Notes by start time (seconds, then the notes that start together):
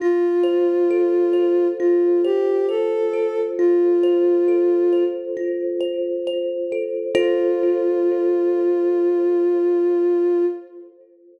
0.00 F4
0.43 C5
0.90 A4
1.33 C5
1.79 F4
2.24 G4 C5
2.69 A4 C5
3.13 A4
3.58 F4
4.03 C5
4.48 A4
4.93 C5
5.37 F4
5.81 C5
6.27 C5
6.72 A4
7.15 F4 A4 C5